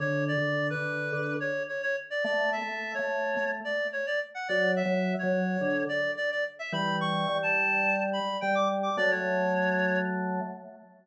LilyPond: <<
  \new Staff \with { instrumentName = "Clarinet" } { \time 4/4 \key d \major \tempo 4 = 107 cis''8 d''8. b'4~ b'16 cis''8 cis''16 cis''16 r16 d''16 | d''8 e''8. cis''4~ cis''16 d''8 cis''16 d''16 r16 fis''16 | d''8 e''8. cis''4~ cis''16 d''8 d''16 d''16 r16 e''16 | b''8 cis'''8. a''4~ a''16 b''8 g''16 d'''16 r16 d'''16 |
d''16 cis''4.~ cis''16 r2 | }
  \new Staff \with { instrumentName = "Drawbar Organ" } { \time 4/4 \key d \major \tuplet 3/2 { d4 d4 d4 } d8 r4. | \tuplet 3/2 { a4 a4 a4 } a8 r4. | \tuplet 3/2 { fis4 fis4 fis4 } d8 r4. | <e g>4 g2 g4 |
<fis a>2. r4 | }
>>